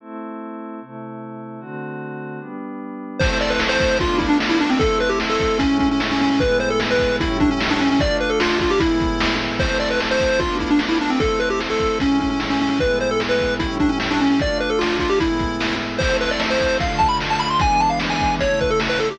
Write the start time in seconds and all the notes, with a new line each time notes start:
0.00 A3 C4 E4
0.81 C3 A3 E4
1.60 D3 A3 C4 F#4
2.40 G3 B3 D4
3.19 A3 C4 E4 C5, kick, crash
3.40 D5, closed hi-hat
3.50 B4
3.60 snare
3.69 C5
3.80 kick, closed hi-hat
3.99 A3 B3 D4 F4, kick, closed hi-hat
4.19 E4, kick, closed hi-hat
4.29 D4
4.40 snare
4.49 E4
4.59 D4, closed hi-hat
4.70 C4
4.79 A3 C4 E4 A4, kick, closed hi-hat
5.00 B4, closed hi-hat
5.09 G4
5.20 snare
5.29 A4
5.40 kick, closed hi-hat
5.59 A2 G#3 C#4 E4, kick, closed hi-hat
5.79 C#4, kick, closed hi-hat
5.91 C#4
6.00 snare
6.11 C#4
6.19 C#4, open hi-hat
6.30 C#4
6.40 A2 G#3 B3 E4 B4, kick, closed hi-hat
6.60 C5, closed hi-hat
6.70 A4
6.80 snare
6.91 B4
6.99 kick, closed hi-hat
7.20 A2 G3 C#4 E4, kick, closed hi-hat
7.40 D4, kick, closed hi-hat
7.51 C#4
7.61 snare
7.70 D4
7.80 C#4, closed hi-hat
7.90 C#4
8.00 A3 D4 F4 D5, kick, closed hi-hat
8.20 B4, closed hi-hat
8.30 A4
8.40 F4, snare
8.60 F4, kick, closed hi-hat
8.70 G4
8.80 A2 G#3 B3 E4, kick, closed hi-hat
9.00 kick, closed hi-hat
9.20 snare
9.40 closed hi-hat
9.59 A3 C4 E4 C5, kick, crash
9.80 D5, closed hi-hat
9.91 B4
10.00 snare
10.11 C5
10.20 kick, closed hi-hat
10.40 A3 B3 D4 F4, kick, closed hi-hat
10.59 E4, kick, closed hi-hat
10.71 D4
10.79 snare
10.89 E4
11.01 D4, closed hi-hat
11.10 C4
11.19 A3 C4 E4 A4, kick, closed hi-hat
11.40 B4, closed hi-hat
11.50 G4
11.60 snare
11.70 A4
11.80 kick, closed hi-hat
11.99 A2 G#3 C#4 E4, kick, closed hi-hat
12.20 C#4, kick, closed hi-hat
12.30 C#4
12.40 snare
12.50 C#4
12.60 C#4, open hi-hat
12.70 C#4
12.79 A2 G#3 B3 E4 B4, kick, closed hi-hat
13.00 C5, closed hi-hat
13.11 A4
13.20 snare
13.29 B4
13.39 kick, closed hi-hat
13.59 A2 G3 C#4 E4, kick, closed hi-hat
13.80 D4, kick, closed hi-hat
13.89 C#4
14.00 snare
14.11 D4
14.20 C#4, closed hi-hat
14.30 C#4
14.39 A3 D4 F4 D5, kick, closed hi-hat
14.60 B4, closed hi-hat
14.70 A4
14.79 F4, snare
14.99 F4, kick, closed hi-hat
15.10 G4
15.20 A2 G#3 B3 E4, kick, closed hi-hat
15.39 kick, closed hi-hat
15.60 snare
15.80 closed hi-hat
15.99 A3 C4 E4 C5, kick, crash
16.19 B4, closed hi-hat
16.31 D5
16.40 snare
16.50 C5
16.60 kick, closed hi-hat
16.80 D3 A3 F4 F5, kick, closed hi-hat
16.98 A5, kick, closed hi-hat
17.09 B5
17.20 snare
17.30 A5
17.40 B5, closed hi-hat
17.50 C6
17.59 E3 G#3 B3 D4 G#5, kick, closed hi-hat
17.80 A5, closed hi-hat
17.90 F5
18.00 snare
18.10 G#5
18.20 kick, closed hi-hat
18.39 C#3 A3 E4 C#5, kick, closed hi-hat
18.59 B4, kick, closed hi-hat
18.70 A4
18.80 snare
18.89 B4
18.99 A4, closed hi-hat
19.11 G4